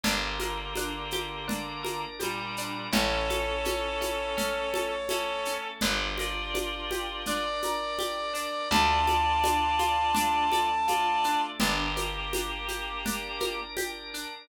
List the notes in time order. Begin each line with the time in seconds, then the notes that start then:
0.03 G1 D3 A#3 D4 G4 A#4, low conga, shaker
0.39 A#4, high conga, shaker
0.75 D4, high conga, shaker
1.11 G4, high conga, shaker
1.47 D4 A#4 D5, low conga, shaker
1.83 A#4, high conga, shaker
2.19 A#2 G3 G4, high conga, shaker
2.57 D4, shaker
2.92 A1 C#4 E4 A4 C#5, low conga, shaker
3.30 A4, high conga, shaker
3.65 C#4, high conga, shaker
4.00 E4, high conga, shaker
4.37 A3 C#4 A4, low conga, shaker
4.74 A4, high conga, shaker
5.09 C#4 E4 A4, high conga, shaker
5.45 C#4, shaker
5.81 G1 D4 F4 G4 A#4 D5, low conga, shaker
6.18 F4 A#4 D5, high conga, shaker
6.54 D4, high conga, shaker
6.91 G4, high conga, shaker
7.26 D4 A#4 D5, low conga, shaker
7.62 A#4, high conga, shaker
7.99 G4, high conga, shaker
8.33 D4, shaker
8.70 D2 D4 F4 A4 D5 A5, low conga, shaker
9.07 A4, high conga, shaker
9.44 D4, high conga, shaker
9.79 F4, high conga, shaker
10.14 A3 D4 A4, low conga, shaker
10.52 A4, high conga, shaker
10.88 F4 D5, high conga, shaker
11.24 D4, shaker
11.60 G1 A#3 D4 G4 A#4, low conga, shaker
11.96 A#4, high conga, shaker
12.33 D4, high conga, shaker
12.68 G4, high conga, shaker
13.05 D4 A#4 D5, low conga, shaker
13.40 A#4, high conga, shaker
13.76 G4, high conga, shaker
14.14 D4, shaker